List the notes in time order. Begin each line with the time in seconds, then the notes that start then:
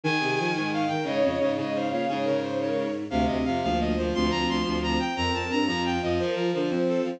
0.04 D#3 G#4 G#5
0.20 C3
0.38 F3
0.54 G#2 G#4 G#5
0.72 G#4 F5
0.88 D#3 A#4 G5
1.04 G#2 C#3 C#5 D#5
1.23 F2 C#3
1.40 G#2 C#3
1.57 G#2 C#3 C#5 D#5
1.74 C#3 C5 F5
1.91 A#2 C#5 F5
2.08 G#2 C#3 G#4 C#5
2.24 C#3 A#4
2.42 C5
2.59 A#4 C#5
3.10 D2 C3 C4 F5
3.26 D2 D#5
3.44 F2 C3 F5
3.62 D2 F3 A#3 F5
3.80 D#5
3.96 D2 F3 C5
4.12 D2 F3 C4 C6
4.30 D2 A#5
4.49 D2 C6
4.63 D2 C4 C6
4.83 A#5
5.00 G5
5.16 F2 C4 A#4 A#5
5.33 F2 A5
5.50 G2 C4 A#5
5.66 F2 F3 F4 A#5
5.85 G5
6.02 F2 F3 D#5
6.19 F3 A#4 C5
6.35 F3 A#4
6.53 D3 F3 C5
6.70 F3 C4 C5
6.88 A4
7.03 F3 C4 F4